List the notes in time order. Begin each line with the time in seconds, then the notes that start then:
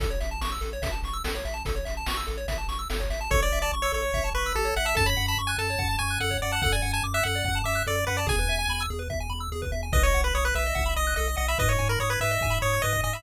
0.00 A1 A4, kick, closed hi-hat
0.10 C#5
0.20 A1 E5, closed hi-hat
0.31 A5
0.41 A1 C#6, snare
0.52 E6
0.61 A1 A4, closed hi-hat
0.73 C#5
0.82 A1 E5, kick, closed hi-hat
0.92 A5
1.03 A1 C#6, closed hi-hat
1.13 E6
1.24 A1 A4, snare
1.35 C#5
1.45 A1 E5, closed hi-hat
1.54 A5
1.65 A1 A4, kick, closed hi-hat
1.76 C#5
1.85 A1 E5, closed hi-hat
1.97 A5
2.06 A1 C#6, snare
2.17 E6
2.27 A1 A4, closed hi-hat
2.37 C#5
2.48 A1 E5, kick, closed hi-hat
2.58 A5
2.68 A1 C#6, closed hi-hat
2.79 E6
2.90 G1 A4, snare
3.00 C#5, kick
3.10 G#1 E5, closed hi-hat
3.21 A5
3.30 A1 A4 C#5, kick
3.40 C#5 D5
3.52 A1 E5
3.62 D5 A5
3.72 A1 C#6
3.82 C#5 E6
3.92 A1 A4 C#5
4.02 C#5
4.14 A1 E5, kick
4.24 A5
4.34 A1 B4 C#6
4.46 E6
4.55 A1 G4 A4
4.65 C#5
4.76 A1 E5 F#5
4.85 E5 A5
4.95 F#2 A4 A5, kick
5.06 C#5 B5
5.17 F#2 F#5
5.28 A5 B5
5.37 F#2 C#6
5.47 G#5 F#6
5.58 F#2 A4 A5
5.70 C#5
5.79 F#2 F#5, kick
5.89 A5
5.99 F#2 G#5 C#6
6.10 F#6
6.20 F#2 A4 F#5
6.31 C#5, kick
6.42 F#2 D5 F#5
6.52 F#5 A5
6.62 F#2 A4 F#5, kick
6.72 D5 G#5
6.82 F#2 F#5
6.93 G#5 A5
7.03 F#2 D6
7.14 E5 F#6
7.23 F#2 A4 F#5
7.35 D5
7.45 F#2 F#5, kick
7.55 A5
7.64 F#2 E5 D6
7.75 F#6
7.87 F#2 A4 D5
7.96 D5
8.07 F#2 B4 F#5
8.17 D5 A5
8.27 E2 G#4 G#5, kick
8.39 B4
8.48 E2 E5
8.59 G#5
8.68 E2 B5
8.81 E6
8.90 E2 G#4
8.99 B4
9.10 E2 E5, kick
9.20 G#5
9.30 E2 B5
9.40 E6
9.52 E2 G#4
9.62 B4, kick
9.72 E2 E5
9.83 G#5
9.93 B1 B4 D#5, kick
10.03 C#5 D#5
10.14 B1 F#5
10.24 B4 B5
10.35 B1 C#5 D#6
10.45 B4 F#6
10.55 B1 B4 E5
10.66 D#5
10.75 B1 F#5, kick
10.86 B5
10.96 B1 D#5 D#6
11.07 F#6
11.16 B1 A4 D#5
11.28 D#5
11.37 B1 D#5 F#5
11.48 E5 B5
11.58 G#2 B4 D#5, kick
11.68 C#5 D#5
11.79 G#2 G#5
11.89 A#4 B5
12.00 G#2 C#5 D#6
12.10 B4 G#6
12.20 G#2 B4 E5
12.31 D#5
12.41 G#2 G#5, kick
12.50 B5
12.62 G#2 C#5 D#6
12.73 G#6
12.82 G#2 B4 D#5
12.93 D#5, kick
13.04 G#2 D#5 G#5
13.13 E5 B5